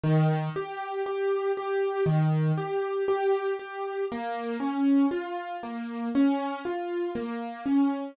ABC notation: X:1
M:4/4
L:1/8
Q:1/4=59
K:Bbm
V:1 name="Acoustic Grand Piano"
E, =G G G E, G G G | B, D F B, D F B, D |]